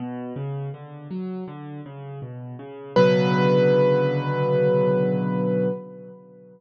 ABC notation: X:1
M:4/4
L:1/8
Q:1/4=81
K:Bm
V:1 name="Acoustic Grand Piano"
z8 | B8 |]
V:2 name="Acoustic Grand Piano" clef=bass
B,, C, D, F, D, C, B,, C, | [B,,C,D,F,]8 |]